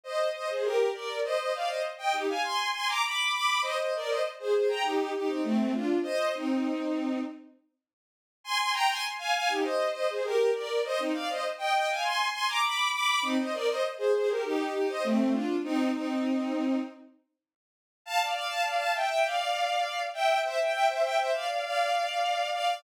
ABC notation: X:1
M:4/4
L:1/16
Q:1/4=100
K:Cm
V:1 name="Violin"
[ce]2 [ce] [Ac] [GB]2 [Bd]2 | [ce] [ce] [df] [ce] z [eg] [EG] [fa] [ac']2 [ac'] [bd'] [=bd']2 [bd']2 | [ce] [ce] [Bd] [ce] z [Ac] [Ac] [gb] [EG]2 [EG] [CE] [=A,C]2 [DF]2 | [ce]2 [CE]6 z8 |
[ac'] [ac'] [gb] [ac'] z [fa] [fa] [EG] [ce]2 [ce] [Ac] [GB]2 [Bd]2 | [ce] [CE] [df] [ce] z [eg] [eg] [fa] [ac']2 [ac'] [bd'] [=bd']2 [bd']2 | [CE] [ce] [Bd] [ce] z [Ac] [Ac] [GB] [EG]2 [EG] [ce] [=A,C]2 [DF]2 | [CE]2 [CE]6 z8 |
[K:Dm] [fa] [df] [df] [fa] [df] [fa] [eg] [eg] [df]6 [eg]2 | [ce] [eg] [eg] [ce] [eg] [ce] [df] [df] [df]6 [df]2 |]